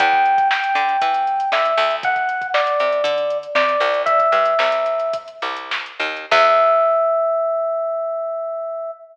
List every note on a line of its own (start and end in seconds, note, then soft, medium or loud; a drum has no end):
0.00 0.64 E2 medium
0.00 0.48 G5 medium
0.00 kick loud
0.00 closed hi-hat loud
0.13 kick medium
0.13 snare soft
0.26 closed hi-hat medium
0.38 kick medium
0.38 closed hi-hat medium
0.51 1.50 G5 medium
0.51 snare loud
0.64 closed hi-hat medium
0.75 0.97 D3 medium
0.75 closed hi-hat medium
0.89 snare soft
0.89 closed hi-hat medium
1.02 1.45 E3 medium
1.02 kick medium
1.02 closed hi-hat loud
1.14 closed hi-hat medium
1.27 closed hi-hat medium
1.40 closed hi-hat medium
1.52 1.74 D3 medium
1.52 1.95 E5 medium
1.52 snare loud
1.65 closed hi-hat medium
1.77 2.68 D2 medium
1.77 snare soft
1.77 closed hi-hat medium
1.91 closed hi-hat medium
2.03 2.47 F#5 medium
2.03 kick loud
2.03 closed hi-hat medium
2.16 kick medium
2.16 closed hi-hat medium
2.29 closed hi-hat medium
2.42 kick medium
2.42 closed hi-hat medium
2.54 3.38 D5 medium
2.54 snare loud
2.67 closed hi-hat medium
2.80 3.02 C3 medium
2.80 closed hi-hat medium
2.92 closed hi-hat medium
3.04 3.47 D3 medium
3.04 kick medium
3.04 closed hi-hat loud
3.18 closed hi-hat medium
3.30 closed hi-hat medium
3.43 closed hi-hat medium
3.55 3.77 C3 medium
3.55 4.02 D5 medium
3.55 snare loud
3.69 snare soft
3.69 closed hi-hat medium
3.80 4.28 C2 medium
3.80 closed hi-hat medium
3.94 closed hi-hat medium
4.06 5.16 E5 medium
4.06 kick medium
4.06 closed hi-hat loud
4.20 kick medium
4.20 closed hi-hat medium
4.32 4.55 G2 medium
4.32 closed hi-hat medium
4.46 closed hi-hat medium
4.59 5.29 C2 medium
4.59 snare loud
4.72 closed hi-hat medium
4.86 closed hi-hat medium
5.00 closed hi-hat medium
5.13 kick medium
5.13 closed hi-hat loud
5.28 closed hi-hat medium
5.42 5.92 C2 medium
5.42 closed hi-hat medium
5.57 closed hi-hat medium
5.71 snare loud
5.86 closed hi-hat medium
6.00 6.26 D#2 medium
6.00 snare soft
6.00 closed hi-hat medium
6.17 closed hi-hat medium
6.31 8.91 E2 loud
6.31 8.91 E5 loud
6.31 kick loud
6.31 crash loud